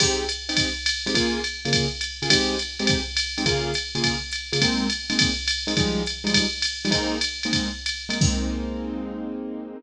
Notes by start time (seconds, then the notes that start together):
0.00 G#3 C4 D#4 G4, kick, crash, ride
0.29 hi-hat pedal, ride
0.49 G#3 C4 D#4 G4, ride
0.57 kick, ride
0.86 hi-hat pedal, ride
1.06 G#3 C4 D#4 G4, ride
1.14 C#3 A#3 F4 G#4, kick, ride
1.44 hi-hat pedal, ride
1.65 C#3 A#3 F4 G#4, ride
1.73 kick, ride
2.01 hi-hat pedal, ride
2.22 C#3 A#3 F4 G#4, ride
2.30 G#3 C4 D#4 G4, kick, ride
2.59 hi-hat pedal, ride
2.79 G#3 C4 D#4 G4, ride
2.87 kick, ride
3.17 hi-hat pedal, ride
3.38 G#3 C4 D#4 G4, ride
3.46 C#3 A#3 F4 G#4, kick, ride
3.74 hi-hat pedal, ride
3.95 C#3 A#3 F4 G#4, ride
4.04 kick, ride
4.31 hi-hat pedal, ride
4.52 C#3 A#3 F4 G#4, ride
4.61 G#3 A#3 C4 D#4, kick, ride
4.90 hi-hat pedal, ride
5.10 G#3 A#3 C4 D#4, ride
5.19 kick, ride
5.48 hi-hat pedal, ride
5.67 G#3 A#3 C4 D#4, ride
5.77 F3 G3 G#3 D#4, kick, ride
6.06 hi-hat pedal, ride
6.24 F3 G3 G#3 D#4, ride
6.33 kick, ride
6.62 hi-hat pedal, ride
6.85 F3 G3 G#3 D#4, ride
6.91 G#3 A#3 C4 D#4, kick, ride
7.21 hi-hat pedal, ride
7.43 G#3 A#3 C4 D#4, ride
7.53 kick, ride
7.86 hi-hat pedal, ride
8.09 G#3 A#3 C4 D#4, ride
8.21 G#3 A#3 C4 D#4, kick, crash